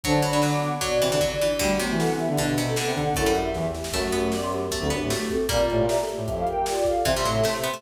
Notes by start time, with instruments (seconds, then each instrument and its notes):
0.03 brass section D3, pizzicato strings F#3, choir aahs D4, ocarina C5 A5, kick, closed hi-hat
0.22 pizzicato strings F#3, ocarina D5 B5, closed hi-hat
0.31 pizzicato strings F#3, choir aahs D4
0.41 pizzicato strings F#3, choir aahs D4, ocarina F#5 D6, snare
0.52 choir aahs B3, ocarina F#5 D6
0.63 closed hi-hat
0.81 pizzicato strings F#3, ocarina F#4 D5, kick, closed hi-hat
0.91 brass section B2
1.01 brass section C3, pizzicato strings E3, closed hi-hat
1.12 brass section D3, pizzicato strings E3
1.20 pizzicato strings F#3, kick, floor tom
1.40 pizzicato strings E3, high tom
1.59 pizzicato strings D3, brass section G3, ocarina A3 F#4, kick, crash
1.78 pizzicato strings C3, brass section F#3, choir aahs B3, closed hi-hat
1.91 brass section E3
1.98 choir aahs D4, ocarina A4 F#5, snare
2.09 choir aahs C4
2.18 brass section E3, choir aahs B3, ocarina G4 E5, closed hi-hat
2.28 brass section D3
2.36 brass section B2, pizzicato strings D3, ocarina D4 B4, kick, closed hi-hat
2.57 pizzicato strings C3, closed hi-hat
2.66 ocarina C4 A4
2.76 pizzicato strings D3, ocarina A4 F#5, snare
2.85 brass section C3
2.95 brass section D3, ocarina A4 F#5, kick, closed hi-hat
3.04 brass section D3
3.14 brass section F#2, pizzicato strings A3, choir aahs E4, ocarina A4 F#5, kick, closed hi-hat
3.26 pizzicato strings G3
3.34 ocarina G4 E5, closed hi-hat
3.54 brass section E2, kick, snare
3.75 snare
3.84 snare
3.93 brass section F#2, pizzicato strings A3, ocarina A3 F#4, kick, crash
4.11 pizzicato strings B3, choir aahs G4, closed hi-hat
4.31 ocarina B3 G4, choir aahs D5, snare
4.41 choir aahs C5
4.50 choir aahs G4, closed hi-hat
4.71 pizzicato strings A3, ocarina B3 G4, kick, closed hi-hat
4.80 brass section D2, ocarina C4 A4
4.90 brass section F#2, pizzicato strings B3, ocarina D4 B4, closed hi-hat
5.01 brass section A2
5.10 ocarina A3 F#4, pizzicato strings A3, snare
5.30 ocarina C4 A4, kick, closed hi-hat
5.49 brass section A#2, pizzicato strings G3 A#3, ocarina F4 D5, kick, closed hi-hat
5.69 brass section A2, choir aahs G4, closed hi-hat
5.80 brass section A#2
5.87 ocarina G4 E5, choir aahs A#4, snare
6.00 choir aahs A4
6.09 choir aahs G4, closed hi-hat
6.17 brass section A2
6.26 brass section F2, ocarina G4 E5, kick, closed hi-hat
6.36 ocarina A4 F5
6.47 ocarina A#4 G5, closed hi-hat
6.66 ocarina F4 D5, snare
6.85 ocarina A4 F5, kick, closed hi-hat
7.05 brass section C3, pizzicato strings E3, ocarina G4 E5, choir aahs C5, kick, closed hi-hat
7.16 pizzicato strings G3
7.23 brass section A2, pizzicato strings F#3, closed hi-hat
7.36 choir aahs A4
7.44 brass section C3, pizzicato strings A3, choir aahs C5, snare
7.62 pizzicato strings B3, closed hi-hat
7.74 pizzicato strings A3